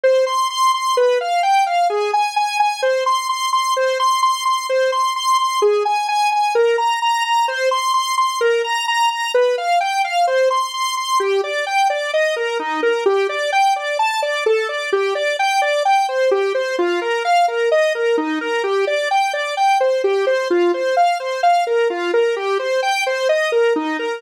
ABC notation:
X:1
M:4/4
L:1/8
Q:1/4=129
K:Cm
V:1 name="Lead 1 (square)"
c c' c' c' =B f g f | A a a a c c' c' c' | c c' c' c' c c' c' c' | A a a a B b b b |
c c' c' c' B b b b | =B f g f c c' c' c' | [K:Gm] G d g d e B E B | G d g d a d A d |
G d g d g c G c | F B f B e B E B | G d g d g c G c | F c f c f B F B |
G c g c e B E B |]